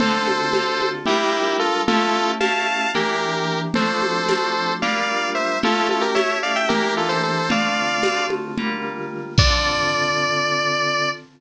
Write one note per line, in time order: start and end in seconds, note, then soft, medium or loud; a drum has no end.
0.00 0.49 D3 loud
0.00 0.49 C4 loud
0.00 0.49 F4 medium
0.00 0.89 A4 medium
0.00 0.49 A4 medium
0.00 0.89 C5 medium
0.00 low conga medium
0.28 high conga medium
0.53 1.02 D3 medium
0.53 1.02 C4 medium
0.53 1.02 F4 medium
0.53 1.02 A4 medium
0.53 tambourine medium
0.53 high conga medium
0.82 high conga medium
1.06 1.79 G3 medium
1.06 1.79 D4 medium
1.06 1.57 E4 medium
1.06 1.79 F4 medium
1.06 1.57 G4 medium
1.06 1.79 A#4 medium
1.06 low conga medium
1.59 1.82 F4 medium
1.59 1.82 A4 medium
1.88 2.36 A3 medium
1.88 2.36 C#4 medium
1.88 2.36 E4 medium
1.88 2.31 F4 medium
1.88 2.36 G4 medium
1.88 2.31 A4 medium
1.88 low conga medium
2.40 2.88 A3 medium
2.40 2.88 C#4 medium
2.40 2.88 E4 medium
2.40 2.88 G4 medium
2.40 2.90 F5 medium
2.40 2.90 A5 medium
2.40 tambourine medium
2.40 high conga medium
2.94 3.67 E3 medium
2.94 3.67 A#3 medium
2.94 3.67 D4 medium
2.94 3.67 G4 medium
2.94 3.60 G4 medium
2.94 3.60 A#4 medium
2.94 low conga medium
3.74 4.23 F3 medium
3.74 4.23 A3 medium
3.74 4.23 C4 medium
3.74 4.23 D4 medium
3.74 4.73 A4 medium
3.74 4.73 C5 medium
3.74 low conga medium
4.02 high conga medium
4.28 4.76 F3 medium
4.28 4.76 A3 medium
4.28 4.76 C4 medium
4.28 4.76 D4 medium
4.28 tambourine medium
4.28 high conga medium
4.82 5.55 G3 medium
4.82 5.55 A#3 medium
4.82 5.55 D4 medium
4.82 5.55 F4 medium
4.82 5.30 D5 medium
4.82 5.30 F5 medium
4.82 low conga medium
5.35 5.58 C5 medium
5.35 5.58 E5 medium
5.62 6.11 A3 medium
5.62 6.11 C#4 medium
5.62 6.11 E4 medium
5.62 5.88 F4 medium
5.62 6.11 G4 medium
5.62 5.88 A4 medium
5.62 low conga medium
5.89 6.03 F4 medium
5.89 6.03 A4 medium
5.89 high conga medium
6.01 6.14 G4 medium
6.01 6.14 A#4 medium
6.15 6.63 A3 medium
6.15 6.63 C#4 medium
6.15 6.63 E4 medium
6.15 6.63 G4 medium
6.15 6.38 C#5 medium
6.15 6.38 E5 medium
6.15 tambourine medium
6.15 high conga medium
6.43 6.55 D5 medium
6.43 6.55 F5 medium
6.56 6.68 E5 medium
6.56 6.68 G5 medium
6.69 7.42 E3 medium
6.69 7.42 A#3 medium
6.69 7.42 D4 medium
6.69 6.94 G4 medium
6.69 7.42 G4 medium
6.69 6.94 A#4 medium
6.69 low conga medium
6.97 7.10 F4 medium
6.97 7.08 A4 medium
7.09 7.22 A4 medium
7.09 7.22 C5 medium
7.23 7.48 A4 medium
7.23 7.48 C5 medium
7.49 7.97 D3 medium
7.49 7.97 A3 medium
7.49 7.97 C4 medium
7.49 7.97 F4 medium
7.49 8.26 D5 medium
7.49 8.26 F5 medium
7.49 low conga medium
8.03 8.51 D3 medium
8.03 8.51 A3 medium
8.03 8.51 C4 medium
8.03 8.51 F4 medium
8.03 tambourine medium
8.03 high conga medium
8.30 high conga medium
8.58 9.30 D3 medium
8.58 9.30 G3 medium
8.58 9.30 A#3 medium
8.58 9.30 F4 medium
8.58 low conga medium
9.38 11.08 D3 loud
9.38 11.08 C4 medium
9.38 11.08 F4 medium
9.38 11.08 A4 loud
9.38 11.09 D5 loud
9.38 kick loud
9.38 crash loud